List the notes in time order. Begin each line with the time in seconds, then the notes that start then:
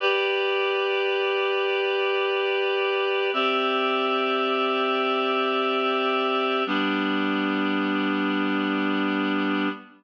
0.00 G4 B4 D5
3.33 C4 G4 D5 E5
6.66 G3 B3 D4